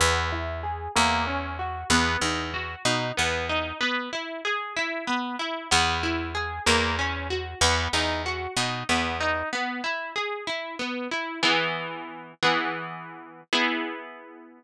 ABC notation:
X:1
M:6/8
L:1/8
Q:3/8=63
K:E
V:1 name="Orchestral Harp"
B, E G ^A, C F | B, D F D B, D | B, E G E B, E | B, E G ^A, C F |
B, D F D B, D | B, E G E B, E | "^rit." [E,B,G]3 [E,B,G]3 | [B,EG]6 |]
V:2 name="Electric Bass (finger)" clef=bass
E,,3 E,,3 | E,, E,,2 B,, E,,2 | z6 | E,,3 E,,3 |
E,, E,,2 B,, E,,2 | z6 | "^rit." z6 | z6 |]